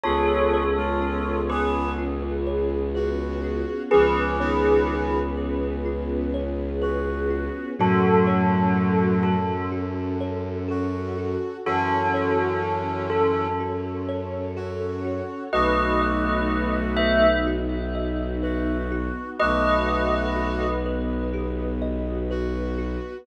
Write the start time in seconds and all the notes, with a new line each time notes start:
0.03 C#2 B3 C#4 F4 G#4 A4 C#5
0.53 C#5
0.77 G#3 F4
1.01 F4
1.49 B3 G#4 B4
1.98 F4
2.47 C#5
2.95 F#4 B4
3.44 F4
3.91 C#2 F3 B3 C#4 F4 G#4 B4
4.40 D#3 B3 C#5
4.88 F4
5.37 B4
5.85 F4
6.34 C#5
6.82 F#4 B4
7.30 F4
7.78 F#2 A2 F#3 C#4 F#4 A4
8.27 C#5
8.76 F#4
9.23 A4
9.72 F#4
10.21 C#5
10.68 F#4 A4
11.18 F#4
11.66 F#2 E3 C#4 F#4 A4 C#5
12.14 C#5
12.63 F#4
13.10 A4
13.60 F#4
14.08 C#5
14.56 F#4 A4
15.04 F#4
15.52 B1 A3 B3 D#4 F#4 B4 D#5
16.01 D#5
16.50 F#4
16.96 B4 E5
17.47 F#4
17.95 D#5
18.43 F#4 B4
18.92 F#4
19.40 B1 A3 B3 F#4 B4 D#5
19.89 D#5
20.36 F#4
20.86 B4
21.33 G4
21.82 D#5
22.31 F#4 B4
22.78 F#4